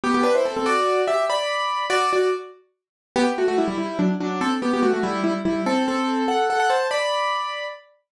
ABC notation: X:1
M:6/8
L:1/16
Q:3/8=96
K:G
V:1 name="Acoustic Grand Piano"
[B,G] [B,G] [DB] [Ec] [CA] [CA] | [Fd]4 [Ge]2 [db]6 | [Fd]2 [Fd]2 z8 | [K:Em] [B,G] z [A,F] [A,F] [G,E] [G,E] [G,E]2 [F,D] z [F,D]2 |
[CA] z [B,G] [B,G] [A,F] [A,F] [G,E]2 [G,E] z [G,E]2 | [CA]2 [CA]4 [Af]2 [Af] [Af] [ca]2 | [db]8 z4 |]